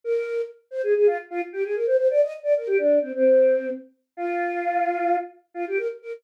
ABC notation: X:1
M:9/8
L:1/16
Q:3/8=87
K:Bbdor
V:1 name="Choir Aahs"
B4 z2 c A A F z F z G A B c c | =d e z d B G =D2 C C5 z4 | F10 z2 F G B z B z |]